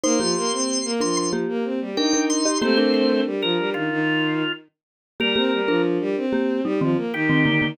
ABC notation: X:1
M:4/4
L:1/16
Q:1/4=93
K:Cdor
V:1 name="Drawbar Organ"
c'6 c' c' z4 g2 c'2 | c c c2 z B2 F5 z4 | B4 z8 G4 |]
V:2 name="Marimba"
[Ec] [B,G]5 [DB]2 [B,G]4 [DB] [DB]2 [Ge] | [B,G] [DB]9 z6 | [B,G] [B,G]2 [DB]4 [B,G]2 [G,E] [E,C] z2 [E,C] [D,B,] [D,B,] |]
V:3 name="Violin"
B, F, B, C2 B, F,3 B, C G, E4 | [A,C]4 G, F, G, E, E,4 z4 | G, C G, F,2 G, C3 G, F, B, E,4 |]